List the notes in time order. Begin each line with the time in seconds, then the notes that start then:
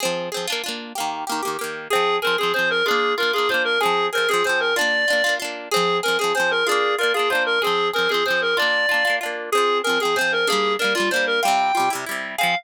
0.00 C4 G#4
0.05 F3
0.32 C4 G#4
0.37 F3
0.47 D4 F4
0.52 A#3
0.64 D4 F4
0.68 A#3
0.95 A#3 G4
1.00 D#3
1.27 A#3 G4
1.32 D#3
1.43 A#3 G4
1.47 D#3
1.59 A#3 G4
1.64 D#3
1.90 C4 G#4
1.95 F3
2.22 C4 G#4 A#4
2.27 F3
2.38 C4 G#4
2.43 F3
2.54 C4 G#4 C5
2.59 F3
2.70 A#4
2.86 D4 F4 G#4
2.91 A#3
3.18 D4 F4 A#4
3.23 A#3
3.33 D4 F4 G#4
3.38 A#3
3.49 D4 F4 C5
3.54 A#3
3.65 A#4
3.80 C4 G#4
3.85 F3
4.13 C4 G#4 A#4
4.18 F3
4.29 C4 G#4
4.33 F3
4.44 C4 G#4 C5
4.49 F3
4.60 A#4
4.76 D4 F4 D5
4.81 A#3
5.08 D4 F4
5.13 A#3
5.24 D4 F4
5.29 A#3
5.40 D4 F4
5.44 A#3
5.71 C4 G#4
5.76 F3
6.03 C4 G#4 A#4
6.08 F3
6.19 C4 G#4
6.24 F3
6.35 C4 G#4 C5
6.40 F3
6.51 A#4
6.67 D4 F4 G#4
6.71 A#3
6.98 D4 F4 A#4
7.03 A#3
7.14 D4 F4 G#4
7.19 A#3
7.30 D4 F4 C5
7.35 A#3
7.46 A#4
7.62 C4 G#4
7.67 F3
7.93 C4 G#4 A#4
7.98 F3
8.09 C4 G#4
8.14 F3
8.26 C4 G#4 C5
8.30 F3
8.41 A#4
8.57 D4 F4 D5
8.62 A#3
8.89 D4 F4
8.94 A#3
9.05 D4 F4
9.10 A#3
9.21 D4 F4
9.26 A#3
9.52 C4 G#4
9.57 F3
9.84 C4 G#4 A#4
9.89 F3
10.00 C4 G#4
10.05 F3
10.16 C4 G#4 C5
10.21 F3
10.32 A#4
10.47 A#3 D4 G#4
10.52 G3
10.79 A#3 D4 A#4
10.84 G3
10.95 A#3 D4 F4
11.00 G3
11.11 A#3 D4 C5
11.16 G3
11.27 A#4
11.43 G3 F4 G5
11.48 C3
11.75 G3 F4
11.80 C3
11.90 G3 E4
11.95 C3
12.06 G3 E4
12.11 C3
12.38 C4 G#4 F5
12.43 F3